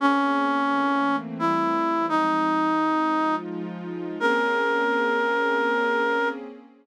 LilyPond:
<<
  \new Staff \with { instrumentName = "Clarinet" } { \time 3/4 \key bes \dorian \tempo 4 = 86 des'2 e'4 | ees'2 r4 | bes'2. | }
  \new Staff \with { instrumentName = "Pad 2 (warm)" } { \time 3/4 \key bes \dorian <bes c' des' aes'>4 <e a bes c'>4 <e g a c'>4 | <f aes c' ees'>4. <f aes ees' f'>4. | <bes c' des' aes'>2. | }
>>